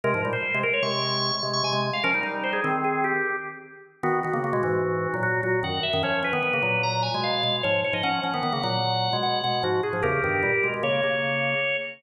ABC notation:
X:1
M:5/4
L:1/16
Q:1/4=150
K:Ab
V:1 name="Drawbar Organ"
B2 z c3 B d d'6 z d' a2 z f | B2 z2 c A2 z A2 G4 z6 | [K:G#m] F2 F4 F6 F2 F2 f2 e2 | c2 B6 a2 g2 ^e4 c2 c d |
f2 f4 f6 f2 f2 F2 G2 | [=GA]8 c10 z2 |]
V:2 name="Drawbar Organ"
[C,A,] [A,,F,] [B,,G,] z2 [C,A,] z2 [C,A,]6 [C,A,]2 [C,A,] [C,A,]2 z | [F,D] [G,E] [G,E]4 [E,C]6 z8 | [K:G#m] [D,B,]2 [D,B,] [C,A,] [C,A,] [B,,G,] [G,,E,]5 [A,,F,]3 [A,,F,]2 [F,,D,]2 z [F,,D,] | [^E,C]2 [E,C] [D,B,] [D,B,] [C,A,] [A,,F,]5 [B,,G,]3 [B,,G,]2 [G,,E,]2 z [G,,E,] |
[^E,C]2 [E,C] [D,B,] [D,B,] [C,A,] [A,,F,]5 [B,,G,]3 [B,,G,]2 [G,,E,]2 z [G,,E,] | [E,,C,]2 [=G,,D,]2 [A,,=G,] z [B,,^G,] [B,,G,] [C,A,]2 [C,A,]6 z4 |]